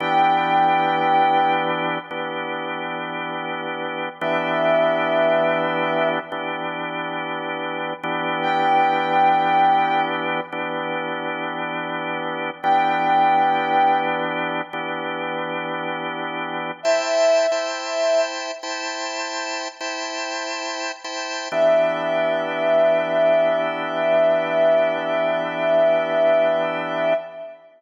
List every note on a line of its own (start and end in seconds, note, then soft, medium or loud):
0.00 1.98 E3 loud
0.00 1.98 B3 loud
0.00 1.98 D4 loud
0.00 1.98 G4 loud
0.00 1.52 G5 medium
2.11 4.09 E3 medium
2.11 4.09 B3 loud
2.11 4.09 D4 medium
2.11 4.09 G4 loud
4.21 6.19 E3 loud
4.21 6.19 B3 loud
4.21 6.19 D4 loud
4.21 6.19 G4 loud
4.21 6.08 E5 medium
6.32 7.93 E3 medium
6.32 7.93 B3 medium
6.32 7.93 D4 loud
6.32 7.93 G4 loud
8.03 10.40 E3 loud
8.03 10.40 B3 loud
8.03 10.40 D4 loud
8.03 10.40 G4 loud
8.42 10.00 G5 medium
10.52 12.50 E3 loud
10.52 12.50 B3 loud
10.52 12.50 D4 loud
10.52 12.50 G4 medium
12.63 14.61 E3 loud
12.63 14.61 B3 loud
12.63 14.61 D4 loud
12.63 14.61 G4 loud
12.63 13.97 G5 medium
14.73 16.71 E3 loud
14.73 16.71 B3 loud
14.73 16.71 D4 medium
14.73 16.71 G4 loud
16.83 17.46 E4 loud
16.83 17.46 C5 loud
16.83 18.20 E5 medium
16.83 17.46 G5 loud
16.83 17.46 A5 loud
17.51 18.51 E4 medium
17.51 18.51 C5 loud
17.51 18.51 G5 medium
17.51 18.51 A5 medium
18.63 19.68 E4 loud
18.63 19.68 C5 loud
18.63 19.68 G5 medium
18.63 19.68 A5 loud
19.80 20.91 E4 loud
19.80 20.91 C5 loud
19.80 20.91 G5 medium
19.80 20.91 A5 loud
21.04 21.48 E4 medium
21.04 21.48 C5 loud
21.04 21.48 G5 loud
21.04 21.48 A5 loud
21.52 27.13 E3 medium
21.52 27.13 B3 medium
21.52 27.13 D4 loud
21.52 27.13 G4 medium
21.52 27.14 E5 loud